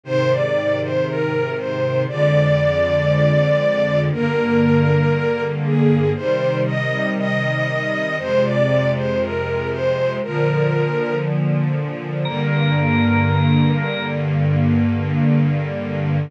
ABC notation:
X:1
M:4/4
L:1/16
Q:1/4=59
K:Eb
V:1 name="String Ensemble 1"
c d2 c B2 c2 d8 | B6 A2 c2 e2 e4 | c d2 c B2 c2 B4 z4 | z16 |]
V:2 name="Drawbar Organ"
z16 | z16 | z16 | B8 z8 |]
V:3 name="String Ensemble 1"
[A,,C,E,]8 [F,,D,A,]8 | [G,,D,B,]8 [C,E,G,]8 | [F,,C,A,]8 [B,,D,F,]8 | [G,,D,B,]16 |]